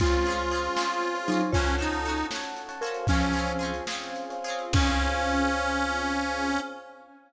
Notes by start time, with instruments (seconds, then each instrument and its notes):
0.00 electric bass (finger) C#2, marimba G#3 F4, string ensemble 1 C4 C#4 F4 G#4, harpsichord C#4 F4 G#4, harmonica F4, electric piano 1 C5 C#5 F5 G#5, kick, closed hi-hat
0.06 harpsichord C4
0.12 electric piano 1 C5 C#5 F5 G#5, closed hi-hat
0.25 harpsichord F4 G#4, closed hi-hat
0.30 harpsichord C4 C#4
0.39 closed hi-hat
0.51 harpsichord C#4 F4 G#4, closed hi-hat
0.57 harpsichord C4
0.64 closed hi-hat
0.76 harpsichord C#4 F4 G#4, electric piano 1 C5 C#5 F5 G#5, snare
0.82 harpsichord C4
0.90 closed hi-hat
1.03 closed hi-hat
1.14 electric piano 1 C5 C#5 F5 G#5, closed hi-hat
1.28 marimba F#3 D#4, harpsichord C#4 F4 G#4, closed hi-hat
1.34 harpsichord C4
1.41 closed hi-hat
1.52 electric bass (finger) C#2, harmonica C#4, string ensemble 1 C#4 F#4 A4, marimba F4 C#5, harpsichord A4, electric piano 1 C#5 F#5 A5, kick, closed hi-hat
1.57 harpsichord C#4 F#4
1.66 electric piano 1 C#5 F#5 A5, closed hi-hat
1.79 harpsichord C#4 F#4 A4, harmonica D#4, closed hi-hat
1.92 closed hi-hat
2.05 harpsichord C#4 F#4 A4, closed hi-hat
2.18 closed hi-hat
2.31 harpsichord F#4 A4, electric piano 1 C#5 F#5 A5, snare
2.35 harpsichord C#4
2.43 closed hi-hat
2.57 closed hi-hat
2.69 electric piano 1 C#5 F#5 A5, closed hi-hat
2.81 harpsichord F#4 A4, marimba A#4, electric piano 1 C5 C#5 F5 G#5, closed hi-hat
2.86 harpsichord C#4
2.94 closed hi-hat
3.07 electric bass (finger) C#2, marimba F3 C#4, string ensemble 1 C4 C#4 F4 G#4, harmonica C#4, harpsichord F4 G#4, kick, closed hi-hat
3.12 harpsichord C4 C#4
3.21 electric piano 1 C5 C#5 F5 G#5, closed hi-hat
3.33 harpsichord C#4 F4 G#4, closed hi-hat
3.39 harpsichord C4
3.47 closed hi-hat
3.59 harpsichord C#4 F4 G#4, closed hi-hat
3.65 harpsichord C4
3.74 closed hi-hat
3.87 harpsichord C#4 F4 G#4, electric piano 1 C5 C#5 F5 G#5, snare
3.93 harpsichord C4
4.02 closed hi-hat
4.16 closed hi-hat
4.30 electric piano 1 C5 C#5 F5 G#5, closed hi-hat
4.44 harpsichord C#4 F4 G#4, closed hi-hat
4.50 harpsichord C4
4.59 closed hi-hat
4.73 electric bass (finger) C#2, string ensemble 1 C4 C#4 F4 G#4, marimba C#4, harmonica C#4, harpsichord G#4, electric piano 1 C5 C#5 F5 G#5, kick, crash
4.77 harpsichord C4 C#4 F4